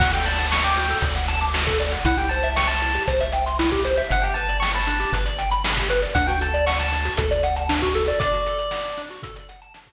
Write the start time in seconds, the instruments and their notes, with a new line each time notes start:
0.00 synth bass 1 D2, lead 1 (square) F#4 F#5, kick, crash
0.12 lead 1 (square) A4 G5, closed hi-hat
0.25 lead 1 (square) D5 A5, closed hi-hat
0.38 lead 1 (square) F#5, closed hi-hat
0.51 lead 1 (square) A5 C#6, snare
0.64 lead 1 (square) G5 D6, closed hi-hat
0.77 lead 1 (square) F#4, closed hi-hat
0.90 lead 1 (square) A4, closed hi-hat
1.02 synth bass 1 D2, lead 1 (square) D5, kick, closed hi-hat
1.15 lead 1 (square) F#5, closed hi-hat
1.28 lead 1 (square) A5, closed hi-hat
1.41 lead 1 (square) D6, closed hi-hat
1.54 lead 1 (square) F#4, snare
1.67 lead 1 (square) A4, kick, closed hi-hat
1.80 lead 1 (square) D5, closed hi-hat
1.92 lead 1 (square) F#5, closed hi-hat
2.05 synth bass 1 C2, lead 1 (square) E4 F#5, kick, closed hi-hat
2.18 lead 1 (square) G4 G5, closed hi-hat
2.29 lead 1 (square) C5 A5, closed hi-hat
2.43 lead 1 (square) E5, closed hi-hat
2.56 lead 1 (square) G5 C#6, snare
2.68 lead 1 (square) A5 C6, closed hi-hat
2.82 lead 1 (square) E4, closed hi-hat
2.94 lead 1 (square) G4, closed hi-hat
3.07 synth bass 1 C2, lead 1 (square) C5, kick, closed hi-hat
3.20 lead 1 (square) E5, closed hi-hat
3.32 lead 1 (square) G5, closed hi-hat
3.46 lead 1 (square) C6, closed hi-hat
3.59 lead 1 (square) E4, snare
3.72 lead 1 (square) G4, kick, closed hi-hat
3.84 lead 1 (square) C5, closed hi-hat
3.97 lead 1 (square) E5, closed hi-hat
4.10 synth bass 1 G1, lead 1 (square) D4 F#5, kick, closed hi-hat
4.22 lead 1 (square) G4 G5, closed hi-hat
4.34 lead 1 (square) B4 A5, closed hi-hat
4.49 lead 1 (square) D5, closed hi-hat
4.60 lead 1 (square) G5 C#6, snare
4.74 lead 1 (square) A5 B5, closed hi-hat
4.87 lead 1 (square) D4, closed hi-hat
5.00 lead 1 (square) G4, closed hi-hat
5.12 synth bass 1 G1, lead 1 (square) B4, kick, closed hi-hat
5.26 lead 1 (square) D5, closed hi-hat
5.38 lead 1 (square) G5, closed hi-hat
5.51 lead 1 (square) B5, closed hi-hat
5.64 lead 1 (square) D4, snare
5.77 lead 1 (square) G4, kick, closed hi-hat
5.90 lead 1 (square) B4, closed hi-hat
6.02 lead 1 (square) D5, closed hi-hat
6.15 synth bass 1 D2, lead 1 (square) D4 F#5, kick, closed hi-hat
6.27 lead 1 (square) F#4 G5, closed hi-hat
6.41 lead 1 (square) A4 A5, closed hi-hat
6.54 lead 1 (square) D5, closed hi-hat
6.66 lead 1 (square) F#5 C#6, snare
6.79 lead 1 (square) A5, closed hi-hat
6.92 lead 1 (square) D4, closed hi-hat
7.05 lead 1 (square) F#4, closed hi-hat
7.17 synth bass 1 D2, lead 1 (square) A4, kick, closed hi-hat
7.31 lead 1 (square) D5, closed hi-hat
7.43 lead 1 (square) F#5, closed hi-hat
7.56 lead 1 (square) A5, closed hi-hat
7.69 lead 1 (square) D4, snare
7.82 lead 1 (square) F#4, kick, closed hi-hat
7.95 lead 1 (square) A4, closed hi-hat
8.08 lead 1 (square) D5, closed hi-hat
8.20 lead 1 (square) D4 D5, kick, closed hi-hat
8.33 lead 1 (square) F#4, closed hi-hat
8.46 lead 1 (square) A4, closed hi-hat
8.59 lead 1 (square) D5, closed hi-hat
8.71 lead 1 (square) F#5, snare
8.85 lead 1 (square) A5, closed hi-hat
8.97 lead 1 (square) D4, closed hi-hat
9.10 lead 1 (square) F#4, closed hi-hat
9.23 lead 1 (square) A4, kick, closed hi-hat
9.36 lead 1 (square) D5, closed hi-hat
9.49 lead 1 (square) F#5, closed hi-hat
9.62 lead 1 (square) A5, closed hi-hat
9.74 lead 1 (square) D4, snare
9.87 lead 1 (square) F#4, kick, closed hi-hat